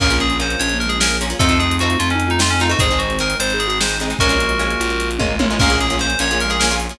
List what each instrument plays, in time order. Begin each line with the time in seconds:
0.00 electric bass (finger) A#1, acoustic guitar (steel) A#3 C#4 F4 G#4, pad 2 (warm) A#3 C#4 F4 G#4, ocarina C#4, electric piano 2 A#4, kick, crash
0.10 acoustic guitar (steel) A#3 C#4 F4 G#4, closed hi-hat
0.20 ocarina C#4, electric piano 2 G#4, closed hi-hat
0.30 closed hi-hat
0.40 acoustic guitar (steel) A#3 C#4 F4 G#4, electric piano 2 C5, closed hi-hat
0.50 closed hi-hat
0.59 electric bass (finger) A#1, ocarina C#4, electric piano 2 C#5, closed hi-hat
0.70 closed hi-hat
0.74 ocarina A#3
0.80 electric piano 2 A#4, closed hi-hat
0.86 ocarina G#3, electric piano 2 G#4, closed hi-hat
1.00 acoustic guitar (steel) A#3 C#4 F4 G#4, electric piano 2 A#4, snare
1.11 closed hi-hat
1.21 acoustic guitar (steel) A#3 C#4 F4 G#4, closed hi-hat
1.30 acoustic guitar (steel) A#3 C#4 F4 G#4, closed hi-hat
1.39 electric bass (finger) F2, acoustic guitar (steel) A3 C4 D#4 F4, pad 2 (warm) A3 C4 D#4 F4, ocarina C4, electric piano 2 A4, kick, closed hi-hat
1.49 acoustic guitar (steel) A3 C4 D#4 F4, closed hi-hat
1.59 ocarina C4, electric piano 2 G#4, closed hi-hat
1.71 closed hi-hat
1.79 acoustic guitar (steel) A3 C4 D#4 F4, electric piano 2 F#4, closed hi-hat
1.90 closed hi-hat
1.99 electric bass (finger) F2, ocarina C4, electric piano 2 F4, closed hi-hat
2.10 electric piano 2 C#4, closed hi-hat
2.14 ocarina D#4
2.20 closed hi-hat
2.27 electric piano 2 D#4, ocarina F4, closed hi-hat
2.39 acoustic guitar (steel) A3 C4 D#4 F4, electric piano 2 F4, snare
2.50 electric piano 2 C#4, closed hi-hat
2.60 acoustic guitar (steel) A3 C4 D#4 F4, electric piano 2 D#4, closed hi-hat
2.70 acoustic guitar (steel) A3 C4 D#4 F4, electric piano 2 F#4, closed hi-hat
2.79 electric bass (finger) G#1, acoustic guitar (steel) G#3 C4 D#4, pad 2 (warm) G#3 C4 D#4, electric piano 2 G#4, ocarina C5, kick, closed hi-hat
2.91 acoustic guitar (steel) G#3 C4 D#4, closed hi-hat
2.99 electric piano 2 F#4, ocarina C5, closed hi-hat
3.10 closed hi-hat
3.19 acoustic guitar (steel) G#3 C4 D#4, electric piano 2 A#4, closed hi-hat
3.30 closed hi-hat
3.40 electric bass (finger) G#1, electric piano 2 C5, ocarina C5, closed hi-hat
3.50 ocarina G#4, closed hi-hat
3.59 electric piano 2 G#4, closed hi-hat
3.67 ocarina F#4, electric piano 2 G#4, closed hi-hat
3.80 acoustic guitar (steel) G#3 C4 D#4, electric piano 2 C5, snare
3.89 closed hi-hat
4.00 acoustic guitar (steel) G#3 C4 D#4, closed hi-hat
4.10 acoustic guitar (steel) G#3 C4 D#4, closed hi-hat
4.19 electric bass (finger) A#1, pad 2 (warm) G#3 A#3 C#4 F4, acoustic guitar (steel) G#3 A#3 C#4 F4, ocarina C#4, electric piano 2 F#4 A#4, kick, closed hi-hat
4.29 acoustic guitar (steel) G#3 A#3 C#4 F4, closed hi-hat
4.40 closed hi-hat
4.49 closed hi-hat
4.59 acoustic guitar (steel) G#3 A#3 C#4 F4, closed hi-hat
4.70 closed hi-hat
4.80 electric bass (finger) A#1, ocarina F4, closed hi-hat
4.90 closed hi-hat
5.00 closed hi-hat
5.11 closed hi-hat
5.19 electric bass (finger) G#1, acoustic guitar (steel) G#3 A#3 C#4 F4, kick, high tom
5.39 electric bass (finger) A1, acoustic guitar (steel) G#3 A#3 C#4 F4, high tom
5.50 acoustic guitar (steel) G#3 A#3 C#4 F4
5.59 electric bass (finger) A#1, acoustic guitar (steel) A#3 C#4 F4 G#4, ocarina C#4, pad 2 (warm) A#4 C#5 F5 G#5, electric piano 2 A#4, kick, crash
5.70 acoustic guitar (steel) A#3 C#4 F4 G#4, closed hi-hat
5.79 ocarina C#4, electric piano 2 G#4, closed hi-hat
5.90 acoustic guitar (steel) A#3 C#4 F4 G#4, closed hi-hat
5.99 acoustic guitar (steel) A#3 C#4 F4 G#4, electric piano 2 C5, closed hi-hat
6.10 closed hi-hat
6.19 electric bass (finger) A#1, acoustic guitar (steel) A#3 C#4 F4 G#4, ocarina C#4, electric piano 2 C#5, closed hi-hat
6.31 acoustic guitar (steel) A#3 C#4 F4 G#4, ocarina A#3, closed hi-hat
6.40 electric piano 2 A#4, closed hi-hat
6.46 ocarina G#3
6.50 acoustic guitar (steel) A#3 C#4 F4 G#4, electric piano 2 G#4, closed hi-hat
6.60 acoustic guitar (steel) A#3 C#4 F4 G#4, electric piano 2 A#4, snare
6.71 acoustic guitar (steel) A#3 C#4 F4 G#4, closed hi-hat
6.80 closed hi-hat
6.89 acoustic guitar (steel) A#3 C#4 F4 G#4, closed hi-hat